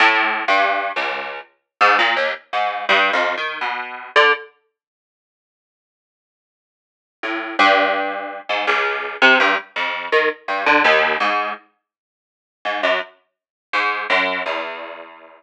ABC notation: X:1
M:4/4
L:1/16
Q:1/4=83
K:none
V:1 name="Pizzicato Strings" clef=bass
(3A,,4 G,,4 ^C,,4 z2 ^G,, ^A,, ^D,, z G,,2 | (3G,,2 F,,2 ^D,2 B,,3 =D, z8 | z8 A,,2 G,,5 ^G,, | ^C,,3 =C, G,, z F,,2 ^D, z G,, =D, ^D,,2 ^G,,2 |
z6 ^G,, ^F,, z4 G,,2 F,,2 | E,,16 |]